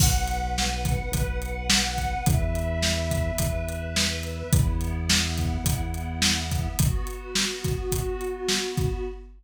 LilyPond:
<<
  \new Staff \with { instrumentName = "Pad 2 (warm)" } { \time 4/4 \key b \minor \tempo 4 = 106 <b' fis''>1 | <b' e''>1 | <b e'>1 | <b fis'>1 | }
  \new Staff \with { instrumentName = "Synth Bass 1" } { \clef bass \time 4/4 \key b \minor b,,2 b,,2 | e,2 e,2 | e,2 e,2 | r1 | }
  \new DrumStaff \with { instrumentName = "Drums" } \drummode { \time 4/4 <cymc bd>8 hh8 sn8 <hh bd>8 <hh bd>8 hh8 sn8 <hh bd>8 | <hh bd>8 hh8 sn8 <hh bd>8 <hh bd>8 hh8 sn8 hh8 | <hh bd>8 hh8 sn8 <hh bd>8 <hh bd>8 hh8 sn8 <hh bd>8 | <hh bd>8 hh8 sn8 <hh bd>8 <hh bd>8 hh8 sn8 <hh bd>8 | }
>>